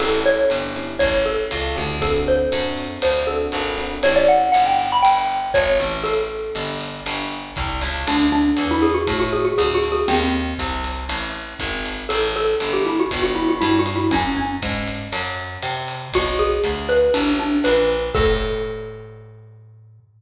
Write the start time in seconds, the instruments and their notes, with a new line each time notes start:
0.00 electric bass (finger) A1, electric piano 1 C#4 E4 G4 A4, xylophone A4, crash, ride
0.26 xylophone C#5
0.50 electric bass (finger) G1, hi-hat pedal, ride
0.76 electric piano 1 C#4 E4 G4 A4, ride
0.99 electric bass (finger) A1, xylophone C#5, kick, ride
1.26 xylophone A4
1.51 electric bass (finger) C#2, hi-hat pedal, ride
1.75 electric bass (finger) D2, electric piano 1 C#4 E4 G4 A4, ride
2.01 electric piano 1 C4 D4 F#4 A4, xylophone A4, kick, ride
2.28 xylophone C5
2.52 electric bass (finger) F#2, electric piano 1 C4 D4 F#4 A4, hi-hat pedal, ride
2.77 ride
3.02 electric bass (finger) D2, xylophone C5, ride
3.27 electric piano 1 C4 D4 F#4 A4, xylophone A4
3.52 electric bass (finger) G#1, hi-hat pedal, ride
3.78 electric piano 1 C4 D4 F#4 A4, ride
4.03 electric bass (finger) A1, electric piano 1 C#4 E4 G4 A4, xylophone C#5, ride
4.16 xylophone D5
4.28 xylophone F#5
4.52 electric bass (finger) G1, xylophone F#5, hi-hat pedal, ride
4.66 xylophone G5
4.79 ride
4.92 xylophone B5
5.03 electric bass (finger) G1, xylophone G5, ride
5.54 electric bass (finger) G#1, xylophone C#5, kick, hi-hat pedal, ride
5.80 electric bass (finger) A1, ride
6.04 xylophone A4, ride
6.55 electric bass (finger) G1, hi-hat pedal, ride
6.81 ride
7.06 electric bass (finger) G1, ride
7.56 electric bass (finger) C2, kick, hi-hat pedal, ride
7.81 electric bass (finger) C#2, ride
8.07 electric bass (finger) D2, xylophone D4, ride
8.32 xylophone D4
8.57 electric bass (finger) E2, hi-hat pedal, ride
8.71 xylophone E4
8.82 xylophone G#4, ride
8.94 xylophone F#4
9.07 electric bass (finger) A2, kick, ride
9.20 xylophone F#4
9.33 xylophone G#4
9.45 xylophone F#4
9.58 electric bass (finger) D2, xylophone G#4, hi-hat pedal, ride
9.74 xylophone F#4
9.84 ride
9.92 xylophone G#4
10.08 electric bass (finger) D#2, xylophone C4, ride
10.59 electric bass (finger) C2, kick, hi-hat pedal, ride
10.84 ride
11.09 electric bass (finger) A1, ride
11.59 electric bass (finger) G#1, kick, hi-hat pedal, ride
11.86 ride
12.09 electric bass (finger) A1, xylophone A4, ride
12.36 xylophone A4
12.60 electric bass (finger) G1, hi-hat pedal, ride
12.73 xylophone G4
12.85 xylophone E4, ride
13.00 xylophone F#4
13.11 electric bass (finger) G1, kick, ride
13.22 xylophone F#4
13.35 xylophone E4
13.49 xylophone F#4
13.61 electric bass (finger) G2, xylophone E4, hi-hat pedal, ride
13.79 xylophone F#4
13.86 ride
13.96 xylophone E4
14.11 electric bass (finger) F#2, xylophone C#4, kick, ride
14.37 xylophone C#4
14.62 electric bass (finger) G#2, kick, hi-hat pedal, ride
14.88 ride
15.12 electric bass (finger) F#2, ride
15.62 electric bass (finger) C3, hi-hat pedal, ride
15.88 ride
16.13 electric bass (finger) B1, xylophone F#4, kick, ride
16.39 xylophone G#4
16.64 electric bass (finger) D2, hi-hat pedal, ride
16.89 xylophone B4, ride
17.14 electric bass (finger) A1, xylophone D4, ride
17.39 xylophone D4
17.64 electric bass (finger) A#1, xylophone B4, hi-hat pedal, ride
17.90 ride
18.14 electric bass (finger) A2, xylophone A4, kick, crash